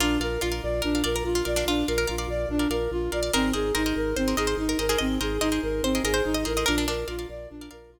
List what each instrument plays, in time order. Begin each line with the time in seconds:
0.00 drawbar organ A#1, flute D4, pizzicato strings F4 A#4 D5 F5
0.20 drawbar organ A#1, pizzicato strings A#4 D5 F5, flute A#4
0.41 drawbar organ A#1, flute F4, pizzicato strings F4 A#4 D5 F5
0.52 pizzicato strings A#4 D5 F5
0.63 drawbar organ A#1, flute D5
0.82 drawbar organ A#1, flute D4, pizzicato strings A#4
0.95 pizzicato strings A#4 D5 F5
1.04 drawbar organ A#1, pizzicato strings A#4 D5 F5, flute A#4
1.16 pizzicato strings A#4
1.24 drawbar organ A#1, flute F4
1.35 pizzicato strings F4
1.45 drawbar organ A#1, pizzicato strings A#4 D5 F5, flute D5
1.56 pizzicato strings D4 A#4 D5 F5
1.66 drawbar organ A#1, flute D4, pizzicato strings F4
1.87 drawbar organ A#1, flute A#4, pizzicato strings A#4 D5 F5
1.98 pizzicato strings A#4
2.07 drawbar organ A#1, flute F4, pizzicato strings A#4 D5 F5
2.18 pizzicato strings A#4 D5 F5
2.28 drawbar organ A#1, flute D5
2.49 drawbar organ A#1, flute D4
2.59 pizzicato strings A#4 D5 F5
2.70 drawbar organ A#1, pizzicato strings A#4 D5 F5, flute A#4
2.91 drawbar organ A#1, flute F4
3.12 drawbar organ A#1, pizzicato strings A#4 D5 F5, flute D5
3.23 pizzicato strings A#4 D5 F5
3.33 drawbar organ G#1, flute C4, pizzicato strings G#4 A#4 C5 D#5
3.53 drawbar organ G#1, pizzicato strings G#4 A#4 C5 D#5, flute G#4
3.75 drawbar organ G#1, flute D#4, pizzicato strings G#4 A#4 C5 D#5
3.86 pizzicato strings G#4 A#4 C5 D#5
3.96 drawbar organ G#1, flute A#4
4.16 drawbar organ G#1, flute C4, pizzicato strings C5
4.28 pizzicato strings G#4 A#4 C5 D#5
4.37 drawbar organ G#1, flute G#4, pizzicato strings G#4 A#4 C5 D#5
4.47 pizzicato strings C5
4.57 drawbar organ G#1, flute D#4
4.69 pizzicato strings A#4
4.79 drawbar organ G#1, pizzicato strings G#4 A#4 C5 D#5, flute A#4
4.89 pizzicato strings G#4 A#4 C5 D#5
4.98 drawbar organ G#1, flute C4, pizzicato strings D#5
5.21 drawbar organ G#1, pizzicato strings G#4 A#4 C5 D#5, flute G#4
5.41 drawbar organ G#1, flute D#4, pizzicato strings G#4 A#4 C5 D#5
5.52 pizzicato strings G#4 A#4 C5 D#5
5.63 drawbar organ G#1, flute A#4
5.83 drawbar organ G#1, flute C4, pizzicato strings C5
5.95 pizzicato strings G#4 A#4 C5 D#5
6.04 drawbar organ G#1, flute G#4, pizzicato strings G#4 A#4 C5 D#5
6.14 pizzicato strings C5
6.25 drawbar organ G#1, flute D#4
6.34 pizzicato strings D#5
6.45 drawbar organ A1, pizzicato strings G#4 A#4 C5 D#5, flute A#4
6.57 pizzicato strings G#4 A#4 C5 D#5
6.66 drawbar organ A#1, flute D4, pizzicato strings A#4 D5 F5
6.78 pizzicato strings D4
6.87 drawbar organ A#1, pizzicato strings D4 A#4 D5 F5, flute A#4
7.08 drawbar organ A#1, flute F4, pizzicato strings A#4 D5 F5
7.19 pizzicato strings A#4 D5 F5
7.29 drawbar organ A#1, flute D5
7.50 drawbar organ A#1, flute D4
7.61 pizzicato strings A#4 D5 F5
7.71 drawbar organ A#1, pizzicato strings A#4 D5 F5, flute A#4
7.90 drawbar organ A#1, flute F4